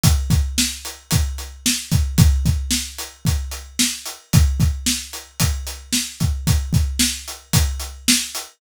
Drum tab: HH |xx-xxx-x|xx-xxx-x|xx-xxx-x|xx-xxx-x|
SD |--o---o-|--o---o-|--o---o-|--o---o-|
BD |oo--o--o|oo--o---|oo--o--o|oo--o---|